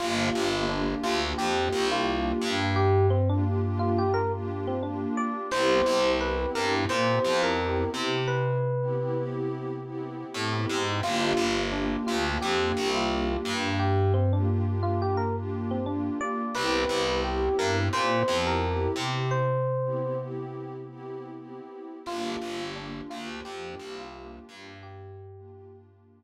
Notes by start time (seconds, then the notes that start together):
0.00 G1 A#3 D4 F4 G4
0.35 G1
0.53 A#3 D4 F4 G4
0.69 A#3 D4 F4 G4
0.88 A#3 D4 F4 G4
1.03 D2 F4
1.38 F2 G4
1.57 A#3 D4 F4 G4
1.73 C2
1.92 F4
2.07 A#3 D4 F4 G4
2.42 G2
2.76 G4
3.10 C4
3.29 A#3 D4 F4 G4
3.44 A#3 D4 F4 G4
3.64 A#3 D4 F4 G4
3.79 F4
3.98 G4
4.14 A#4
4.33 A#3 D4 F4 G4
4.67 C4
4.83 A#3 D4 F4 G4
5.17 D5
5.51 C2 B3 C4 E4 G4 C5
5.86 C2
6.05 B3 C4 E4 G4
6.20 B3 C4 E4 G4 B4
6.40 B3 C4 E4 G4
6.55 G2 A#4
6.89 A#2 C5
7.09 B3 C4 E4 G4
7.24 F2
7.43 A#4
7.59 B3 C4 E4 G4
7.94 C3
8.28 B4
8.81 B3 C4 E4 G4
8.97 B3 C4 E4 G4
9.16 B3 C4 E4 G4
9.85 B3 C4 E4 G4
10.34 A2 B3 C4 E4 G4
10.69 G#2
11.03 G1 A#3 D4 F4 G4
11.37 G1
11.57 A#3 D4 F4 G4
11.72 A#3 D4 F4 G4
11.92 A#3 D4 F4 G4
12.07 D2 F4
12.41 F2 G4
12.60 A#3 D4 F4 G4
12.77 C2
12.95 F4
13.11 A#3 D4 F4 G4
13.45 G2
13.79 G4
14.14 C4
14.33 A#3 D4 F4 G4
14.48 A#3 D4 F4 G4
14.67 A#3 D4 F4 G4
14.83 F4
15.02 G4
15.17 A#4
15.36 A#3 D4 F4 G4
15.71 C4
15.86 A#3 D4 F4 G4
16.21 D5
16.55 C2 B3 C4 E4 G4 B4
16.89 C2
17.08 B3 C4 E4 G4
17.24 B3 C4 E4 G4
17.43 B3 C4 E4 G4
17.59 G2 A#4
17.93 A#2 C5
18.13 B3 C4 E4 G4
18.28 F2
18.47 A#4
18.62 B3 C4 E4 G4
18.96 C3
19.31 C5
19.84 B3 C4 E4 G4
20.00 B3 C4 E4 G4
20.19 B3 C4 E4 G4
20.89 B3 C4 E4 G4
21.38 B3 C4 E4 G4
22.06 G1 A#3 D4 F4 G4
22.42 G1
22.60 A#3 D4 F4 G4
22.76 A#3 D4 F4 G4
22.95 A#3 D4 F4 G4
23.10 D2 F4
23.45 F2 G4
23.64 A#3 D4 F4 G4
23.79 C2
23.98 F4
24.14 A#3 D4 F4 G4
24.49 G2
24.83 G4
25.36 A#3 D4 F4 G4
25.51 A#3 D4 F4 G4
25.71 A#3 D4 F4 G4